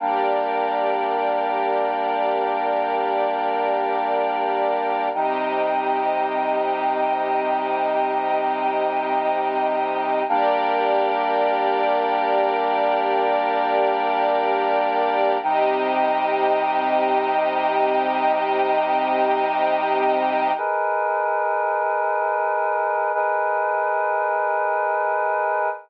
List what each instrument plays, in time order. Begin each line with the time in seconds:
0.00 choir aahs G3 A#3 D4, string ensemble 1 G4 A#4 D5
5.14 choir aahs C3 G3 D#4, string ensemble 1 C4 G4 D#5
10.28 choir aahs G3 A#3 D4, string ensemble 1 G4 A#4 D5
15.42 choir aahs C3 G3 D#4, string ensemble 1 C4 G4 D#5
20.57 choir aahs G#4 A#4 B4 D#5
23.14 choir aahs G#4 A#4 B4 D#5